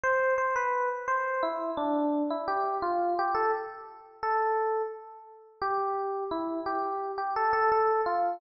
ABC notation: X:1
M:4/4
L:1/16
Q:1/4=86
K:C
V:1 name="Electric Piano 1"
c2 c B2 z c2 E2 D3 E G2 | F2 G A z4 A4 z4 | G4 E2 G3 G A A A2 F2 |]